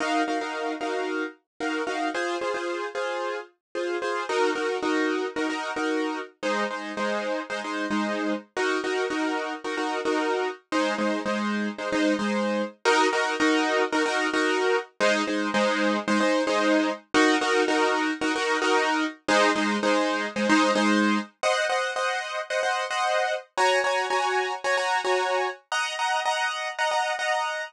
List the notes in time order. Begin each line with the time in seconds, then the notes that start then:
0.00 D#4 F#4 A#4 F5
0.27 D#4 F#4 A#4 F5
0.41 D#4 F#4 A#4 F5
0.80 D#4 F#4 A#4 F5
1.60 D#4 F#4 A#4 F5
1.87 D#4 F#4 A#4 F5
2.14 F4 G#4 C5
2.41 F4 G#4 C5
2.54 F4 G#4 C5
2.95 F4 G#4 C5
3.75 F4 G#4 C5
4.02 F4 G#4 C5
4.29 D#4 F#4 A#4
4.55 D#4 F#4 A#4
4.82 D#4 F#4 A#4
5.36 D#4 F#4 A#4
5.49 D#4 F#4 A#4
5.76 D#4 F#4 A#4
6.43 G#3 D#4 C5
6.70 G#3 D#4 C5
6.97 G#3 D#4 C5
7.50 G#3 D#4 C5
7.64 G#3 D#4 C5
7.90 G#3 D#4 C5
8.56 D#4 F#4 A#4
8.84 D#4 F#4 A#4
9.10 D#4 F#4 A#4
9.64 D#4 F#4 A#4
9.77 D#4 F#4 A#4
10.05 D#4 F#4 A#4
10.72 G#3 D#4 C5
10.98 G#3 D#4 C5
11.25 G#3 D#4 C5
11.78 G#3 D#4 C5
11.92 G#3 D#4 C5
12.19 G#3 D#4 C5
12.85 D#4 F#4 A#4
13.12 D#4 F#4 A#4
13.40 D#4 F#4 A#4
13.92 D#4 F#4 A#4
14.06 D#4 F#4 A#4
14.33 D#4 F#4 A#4
15.00 G#3 D#4 C5
15.27 G#3 D#4 C5
15.54 G#3 D#4 C5
16.07 G#3 D#4 C5
16.20 G#3 D#4 C5
16.47 G#3 D#4 C5
17.14 D#4 F#4 A#4
17.41 D#4 F#4 A#4
17.68 D#4 F#4 A#4
18.21 D#4 F#4 A#4
18.35 D#4 F#4 A#4
18.61 D#4 F#4 A#4
19.28 G#3 D#4 C5
19.55 G#3 D#4 C5
19.83 G#3 D#4 C5
20.36 G#3 D#4 C5
20.49 G#3 D#4 C5
20.75 G#3 D#4 C5
21.43 C5 D#5 F#5
21.69 C5 D#5 F#5
21.96 C5 D#5 F#5
22.50 C5 D#5 F#5
22.63 C5 D#5 F#5
22.90 C5 D#5 F#5
23.57 F#4 C#5 G#5 A#5
23.84 F#4 C#5 G#5 A#5
24.10 F#4 C#5 G#5 A#5
24.64 F#4 C#5 G#5 A#5
24.77 F#4 C#5 G#5 A#5
25.04 F#4 C#5 G#5 A#5
25.71 D#5 F#5 A#5
25.99 D#5 F#5 A#5
26.25 D#5 F#5 A#5
26.78 D#5 F#5 A#5
26.91 D#5 F#5 A#5
27.19 D#5 F#5 A#5